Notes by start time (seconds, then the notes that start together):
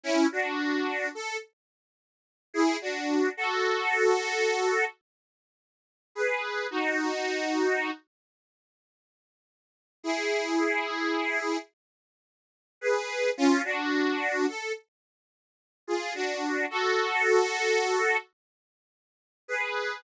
0.03 C#4 E4
0.32 D4 F#4
1.15 A4
2.54 E4 G#4
2.81 D4 F#4
3.37 F#4 A4
6.15 G#4 B4
6.71 D#4 F#4
10.03 E4 G#4
12.81 G#4 B4
13.37 C#4 F4
13.65 D4 F#4
14.48 A4
15.87 F4 G#4
16.15 D4 F#4
16.70 F#4 A4
19.48 G#4 B4